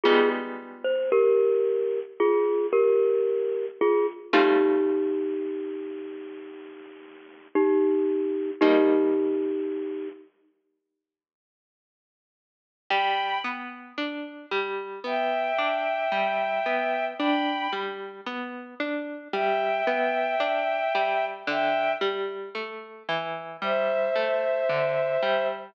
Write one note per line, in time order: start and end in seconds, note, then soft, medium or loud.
0.03 4.25 G3 medium
0.03 4.25 G#3 medium
0.03 4.25 B3 medium
0.03 4.25 D#4 medium
0.03 0.29 F4 medium
0.03 0.29 G#4 medium
0.84 1.10 C5 medium
1.12 2.00 G4 medium
1.12 2.00 A#4 medium
2.20 2.67 F4 medium
2.20 2.67 G#4 medium
2.73 3.66 G4 medium
2.73 3.66 A#4 medium
3.81 4.06 F4 medium
3.81 4.06 G#4 medium
4.33 8.53 G3 medium
4.33 8.53 A3 medium
4.33 8.53 C4 medium
4.33 7.48 D#4 medium
4.33 8.53 F4 medium
4.33 7.48 G4 medium
7.55 8.51 D#4 medium
7.55 8.51 G4 medium
8.61 12.82 G3 medium
8.61 12.82 A#3 medium
8.61 10.08 D#4 medium
8.61 12.82 D#4 medium
8.61 10.08 G4 medium
12.90 13.39 G3 medium
12.90 13.38 G5 medium
12.90 13.38 B5 loud
13.44 13.92 B3 medium
13.98 14.46 D4 medium
14.51 15.00 G3 medium
15.04 15.52 B3 medium
15.04 17.05 E5 medium
15.04 17.05 G5 medium
15.58 16.06 D4 medium
16.12 16.60 G3 medium
16.66 17.14 B3 medium
17.19 17.68 D4 medium
17.19 17.70 G5 medium
17.19 17.70 B5 loud
17.73 18.21 G3 medium
18.26 18.75 B3 medium
18.80 19.28 D4 medium
19.33 19.81 G3 medium
19.33 21.25 E5 medium
19.33 21.25 G5 medium
19.87 20.35 B3 medium
20.40 20.88 D4 medium
20.95 21.43 G3 medium
21.47 21.95 D3 medium
21.47 21.92 E5 medium
21.47 21.92 G5 loud
22.01 22.49 G3 medium
22.55 23.03 A3 medium
23.08 23.57 E3 medium
23.62 24.10 G3 medium
23.62 25.47 C5 medium
23.62 25.47 E5 medium
24.15 24.64 A3 medium
24.69 25.17 D3 medium
25.22 25.71 G3 medium